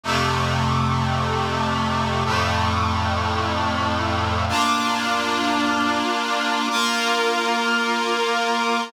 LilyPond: \new Staff { \time 4/4 \key d \minor \tempo 4 = 54 <f, c a>2 <f, a, a>2 | <bes d' f'>2 <bes f' bes'>2 | }